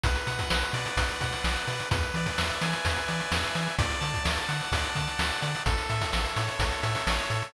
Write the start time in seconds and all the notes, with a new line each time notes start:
0.04 B1 B4, kick, closed hi-hat
0.15 closed hi-hat
0.27 B2 F#5, closed hi-hat
0.39 kick, closed hi-hat
0.50 B1 B4, snare
0.62 closed hi-hat
0.73 B2 D5, closed hi-hat
0.86 closed hi-hat
0.97 B1 B4, kick, closed hi-hat
1.09 closed hi-hat
1.21 B2 F#5, kick, closed hi-hat
1.32 closed hi-hat
1.44 B1 D5, snare
1.56 closed hi-hat
1.67 B2 B4, closed hi-hat
1.79 closed hi-hat
1.91 E2 B4, kick, closed hi-hat
2.03 closed hi-hat
2.14 E3 D5, closed hi-hat
2.26 kick, closed hi-hat
2.38 E2 E5, snare
2.50 closed hi-hat
2.61 E3 G#5, closed hi-hat
2.73 closed hi-hat
2.85 E2 B4, kick, closed hi-hat
2.96 closed hi-hat
3.08 E3 D5, closed hi-hat
3.20 closed hi-hat
3.32 E2 E5, snare
3.44 closed hi-hat
3.55 E3 G#5, closed hi-hat
3.67 closed hi-hat
3.79 D2 D5, kick, closed hi-hat
3.90 closed hi-hat
4.00 D3 A5, closed hi-hat
4.14 kick, closed hi-hat
4.24 D2 D5, snare
4.37 closed hi-hat
4.48 D3 F#5, closed hi-hat
4.61 closed hi-hat
4.72 D2 D5, kick, closed hi-hat
4.84 closed hi-hat
4.95 D3 A5, kick, closed hi-hat
5.07 closed hi-hat
5.18 D2 F#5, snare
5.31 closed hi-hat
5.41 D3 D5, closed hi-hat
5.54 closed hi-hat
5.66 A1 A4, kick, closed hi-hat
5.78 closed hi-hat
5.89 A2 E5, closed hi-hat
6.01 kick, closed hi-hat
6.12 A1 A4, snare
6.25 closed hi-hat
6.36 A2 C#5, closed hi-hat
6.48 closed hi-hat
6.59 A1 A4, kick, closed hi-hat
6.72 closed hi-hat
6.82 A2 E5, closed hi-hat
6.95 closed hi-hat
7.07 A1 C#5, snare
7.19 closed hi-hat
7.30 A2 A4, closed hi-hat
7.42 closed hi-hat